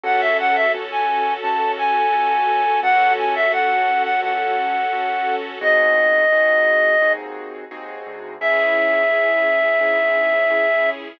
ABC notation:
X:1
M:4/4
L:1/16
Q:1/4=86
K:C#m
V:1 name="Clarinet"
f e f e z g3 a2 g6 | f2 g e f3 f f8 | d10 z6 | e16 |]
V:2 name="Acoustic Grand Piano"
[CFA]4 [CFA]4 [CFA]4 [CFA]4 | [CFA]4 [CFA]4 [CFA]4 [CFA]4 | [^B,DFG]4 [B,DFG]4 [B,DFG]4 [B,DFG]4 | [CEG]4 [CEG]4 [CEG]4 [CEG]4 |]
V:3 name="String Ensemble 1"
[CFA]16 | [CFA]16 | z16 | [CEG]16 |]
V:4 name="Acoustic Grand Piano" clef=bass
C,,4 C,,4 C,,4 C,,4 | C,,4 C,,4 C,,4 C,,4 | C,,4 C,,4 D,,4 D,,2 =D,,2 | C,,4 C,,4 G,,4 C,,4 |]